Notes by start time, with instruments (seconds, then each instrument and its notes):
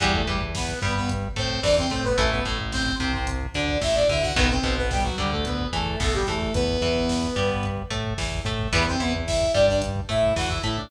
0.00 synth bass 1 E2, overdriven guitar E3 G3 B3, lead 2 (sawtooth) G3 G4, kick, closed hi-hat
0.13 lead 2 (sawtooth) A3 A4, kick
0.26 synth bass 1 E2, overdriven guitar E3, lead 2 (sawtooth) G3 G4, kick, closed hi-hat
0.41 kick
0.55 lead 2 (sawtooth) B3 B4, kick, snare
0.68 kick
0.81 synth bass 1 G2, overdriven guitar G3, lead 2 (sawtooth) B3 B4, kick, closed hi-hat
0.95 lead 2 (sawtooth) B3 B4, kick
1.09 kick, closed hi-hat
1.23 kick
1.36 synth bass 1 A2, overdriven guitar A3, lead 2 (sawtooth) C4 C5, kick, closed hi-hat
1.50 kick
1.63 synth bass 1 E2, overdriven guitar E3, lead 2 (sawtooth) D4 D5, kick, snare
1.78 lead 2 (sawtooth) C4 C5, kick
1.90 synth bass 1 A2, overdriven guitar A3, lead 2 (sawtooth) C4 C5, kick, closed hi-hat
2.04 lead 2 (sawtooth) B3 B4, kick
2.17 synth bass 1 A1, overdriven guitar E3 A3, lead 2 (sawtooth) A3 A4, kick, closed hi-hat
2.31 lead 2 (sawtooth) B3 B4, kick
2.45 synth bass 1 A1, overdriven guitar A2, lead 2 (sawtooth) A3 A4, kick, closed hi-hat
2.59 kick
2.72 lead 2 (sawtooth) C4 C5, kick, snare
2.86 kick
2.99 synth bass 1 C2, overdriven guitar C3, lead 2 (sawtooth) C4 C5, kick, closed hi-hat
3.13 lead 2 (sawtooth) C4 C5, kick
3.27 kick, closed hi-hat
3.41 kick
3.54 synth bass 1 D2, overdriven guitar D3, lead 2 (sawtooth) D4 D5, kick, closed hi-hat
3.68 kick
3.81 synth bass 1 A1, overdriven guitar A2, lead 2 (sawtooth) E4 E5, kick, snare
3.95 lead 2 (sawtooth) D4 D5, kick
4.09 synth bass 1 D2, overdriven guitar D3, lead 2 (sawtooth) E4 E5, kick, closed hi-hat
4.22 lead 2 (sawtooth) F#4 F#5, kick
4.36 synth bass 1 B1, overdriven guitar D#3 F#3 B3, lead 2 (sawtooth) B3 B4, kick, closed hi-hat
4.50 lead 2 (sawtooth) C4 C5, kick
4.63 synth bass 1 B1, overdriven guitar B2, kick, closed hi-hat
4.78 lead 2 (sawtooth) B3 B4, kick
4.91 lead 2 (sawtooth) G3 G4, kick, snare
5.03 lead 2 (sawtooth) F#3 F#4, kick
5.18 synth bass 1 D2, overdriven guitar D3, lead 2 (sawtooth) G3 G4, kick, closed hi-hat
5.32 lead 2 (sawtooth) A3 A4, kick
5.45 lead 2 (sawtooth) B3 B4, kick, closed hi-hat
5.59 kick
5.73 synth bass 1 E2, overdriven guitar E3, lead 2 (sawtooth) A3 A4, kick, closed hi-hat
5.86 kick
6.00 synth bass 1 B1, overdriven guitar B2, lead 2 (sawtooth) A3 A4, kick, snare
6.14 lead 2 (sawtooth) G3 G4, kick
6.27 synth bass 1 E2, overdriven guitar E3, lead 2 (sawtooth) A3 A4, kick, closed hi-hat
6.41 kick
6.54 synth bass 1 E2, lead 2 (sawtooth) B3 B4, kick, closed hi-hat
6.68 kick
6.81 synth bass 1 E2, overdriven guitar E3, kick, closed hi-hat
6.96 kick
7.09 kick, snare
7.23 kick
7.36 synth bass 1 G2, overdriven guitar G3, kick
7.50 kick
7.63 kick, closed hi-hat
7.77 kick
7.90 synth bass 1 A2, overdriven guitar A3, kick, closed hi-hat
8.04 kick
8.18 synth bass 1 E2, overdriven guitar E3, kick, snare
8.32 kick
8.45 synth bass 1 A2, overdriven guitar A3, kick, closed hi-hat
8.59 kick
8.73 synth bass 1 E2, overdriven guitar E3 G3 B3, lead 2 (sawtooth) B3 B4, kick, closed hi-hat
8.86 lead 2 (sawtooth) C4 C5, kick
9.00 synth bass 1 E2, overdriven guitar E3, lead 2 (sawtooth) B3 B4, kick, closed hi-hat
9.13 kick
9.27 lead 2 (sawtooth) E4 E5, kick, snare
9.41 kick
9.54 synth bass 1 G2, overdriven guitar G3, lead 2 (sawtooth) D4 D5, kick, closed hi-hat
9.68 lead 2 (sawtooth) D4 D5, kick
9.82 kick, closed hi-hat
9.96 kick
10.09 synth bass 1 A2, overdriven guitar A3, lead 2 (sawtooth) E4 E5, kick, closed hi-hat
10.23 kick
10.36 synth bass 1 E2, overdriven guitar E3, lead 2 (sawtooth) F#4 F#5, kick, snare
10.49 lead 2 (sawtooth) E4 E5, kick
10.63 synth bass 1 A2, overdriven guitar A3, lead 2 (sawtooth) E4 E5, kick, closed hi-hat
10.77 lead 2 (sawtooth) D4 D5, kick